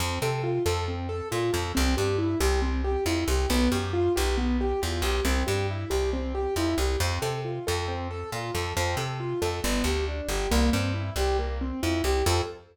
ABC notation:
X:1
M:4/4
L:1/8
Q:1/4=137
K:F
V:1 name="Acoustic Grand Piano"
C A F A C A F A | C G E G C G E G | =B, G F G B, G F G | C G E G C G E G |
C A F A C A F A | C A F A =B, G D G | B, C E G B, C E G | [CFA]2 z6 |]
V:2 name="Electric Bass (finger)" clef=bass
F,, C,2 F,,3 B,, F,, | C,, G,,2 C,,3 F,, C,, | =B,,, _G,,2 B,,,3 E,, B,,, | C,, G,,2 C,,3 F,, C,, |
F,, C,2 F,,3 B,, F,, | F,, C,2 F,, G,,, D,,2 G,,, | C,, G,,2 C,,3 F,, C,, | F,,2 z6 |]